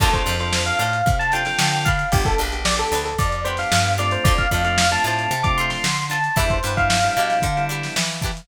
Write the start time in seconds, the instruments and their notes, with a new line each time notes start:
0.00 electric bass (finger) D2, drawbar organ C4 D4 F4 A4, acoustic guitar (steel) D4 F4 A4 C5, electric piano 1 A4, kick, crash
0.13 drawbar organ C4 D4 F4 A4, electric piano 1 C5, kick, snare, closed hi-hat
0.26 electric bass (finger) F2, acoustic guitar (steel) D4 F4 A4 C5, closed hi-hat
0.39 drawbar organ C4 D4 F4 A4, electric piano 1 C5, snare, closed hi-hat
0.53 snare
0.66 electric piano 1 F5, closed hi-hat
0.79 electric bass (finger) A2, acoustic guitar (steel) D4 F4 A4 C5, electric piano 1 F5, closed hi-hat
0.93 closed hi-hat
1.06 electric bass (finger) C3, kick, closed hi-hat
1.19 electric piano 1 A5, closed hi-hat
1.32 drawbar organ C4 D4 F4 A4, acoustic guitar (steel) D4 F4 A4, electric piano 1 G5, snare, closed hi-hat
1.36 acoustic guitar (steel) C5
1.45 drawbar organ C4 D4 F4 A4, electric piano 1 G5, snare, closed hi-hat
1.59 electric bass (finger) D3, snare
1.72 closed hi-hat
1.85 acoustic guitar (steel) D4 G4 B4, electric piano 1 F5, kick, closed hi-hat
1.99 closed hi-hat
2.12 electric bass (finger) G1, drawbar organ B3 D4 G4, electric piano 1 G4, kick, closed hi-hat
2.25 drawbar organ B3 D4 G4, electric piano 1 A4, kick, snare, closed hi-hat
2.38 electric bass (finger) A#1, acoustic guitar (steel) D4 G4 B4, closed hi-hat
2.52 drawbar organ B3 D4 G4, closed hi-hat
2.65 electric piano 1 D5, snare
2.79 electric piano 1 A4, closed hi-hat
2.91 electric bass (finger) D2, acoustic guitar (steel) D4 G4 B4, snare, closed hi-hat
3.05 electric piano 1 A4, snare, closed hi-hat
3.18 electric bass (finger) F2, electric piano 1 D5, kick, closed hi-hat
3.32 closed hi-hat
3.45 drawbar organ B3 D4 G4, acoustic guitar (steel) D4 G4 B4, electric piano 1 C5, closed hi-hat
3.57 drawbar organ B3 D4 G4, electric piano 1 F5, snare, closed hi-hat
3.72 electric bass (finger) G2, snare
3.85 closed hi-hat
3.98 drawbar organ A3 C4 D4 F4, acoustic guitar (steel) D4 G4 B4, electric piano 1 D5, closed hi-hat
4.11 electric piano 1 C5, closed hi-hat
4.24 electric bass (finger) D2, acoustic guitar (steel) D4 F4 A4, electric piano 1 D5, kick, closed hi-hat
4.28 acoustic guitar (steel) C5
4.38 electric piano 1 F5, kick, closed hi-hat
4.51 electric bass (finger) F2, drawbar organ A3 C4 D4 F4, acoustic guitar (steel) D4 F4 A4 C5, kick, closed hi-hat
4.65 drawbar organ A3 C4 D4 F4, electric piano 1 F5, closed hi-hat
4.78 snare
4.91 drawbar organ A3 C4 D4 F4, electric piano 1 A5, closed hi-hat
5.04 electric bass (finger) A2, acoustic guitar (steel) D4 F4 A4 C5, electric piano 1 A5, closed hi-hat
5.19 closed hi-hat
5.31 electric bass (finger) C3, closed hi-hat
5.43 drawbar organ A3 C4 D4 F4, electric piano 1 D6, kick, closed hi-hat
5.58 acoustic guitar (steel) D4 F4 A4 C5, electric piano 1 C6, closed hi-hat
5.70 electric piano 1 C6, snare, closed hi-hat
5.84 electric bass (finger) D3, snare
5.97 closed hi-hat
6.10 acoustic guitar (steel) D4 F4 A4 C5, electric piano 1 A5, closed hi-hat
6.24 closed hi-hat
6.36 electric bass (finger) E2, drawbar organ G3 B3 D4 E4, acoustic guitar (steel) D4 E4 G4 B4, electric piano 1 E5, kick, closed hi-hat
6.50 electric piano 1 C5, kick, closed hi-hat
6.63 electric bass (finger) G2, drawbar organ G3 B3 D4 E4, acoustic guitar (steel) D4 E4 G4, closed hi-hat
6.67 acoustic guitar (steel) B4
6.77 drawbar organ G3 B3 D4 E4, electric piano 1 F5, kick, closed hi-hat
6.90 snare
7.03 drawbar organ G3 B3 D4 E4, closed hi-hat
7.17 electric bass (finger) B2, acoustic guitar (steel) D4 E4 G4 B4, closed hi-hat
7.30 snare, closed hi-hat
7.42 electric bass (finger) D3, kick, closed hi-hat
7.57 drawbar organ G3 B3 D4 E4, closed hi-hat
7.69 acoustic guitar (steel) D4 E4 G4 B4, closed hi-hat
7.83 snare, closed hi-hat
7.96 electric bass (finger) E3, snare
8.10 snare, closed hi-hat
8.22 acoustic guitar (steel) D4 E4 G4 B4, kick, snare, closed hi-hat
8.37 closed hi-hat